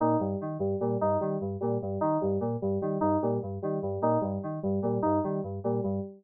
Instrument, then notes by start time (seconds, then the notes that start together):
electric piano 2
0.00 A#2 D#4
0.19 G2 G3
0.41 D#3
0.59 G2 G3
0.80 A#2 G3
1.01 G2 D#4
1.21 D#3 G3
1.41 G2
1.61 A#2 G3
1.82 G2 G3
2.01 D#3 D#4
2.21 G2 G3
2.41 A#2
2.62 G2 G3
2.82 D#3 G3
3.01 G2 D#4
3.22 A#2 G3
3.43 G2
3.62 D#3 G3
3.82 G2 G3
4.02 A#2 D#4
4.21 G2 G3
4.43 D#3
4.63 G2 G3
4.82 A#2 G3
5.02 G2 D#4
5.24 D#3 G3
5.43 G2
5.64 A#2 G3
5.84 G2 G3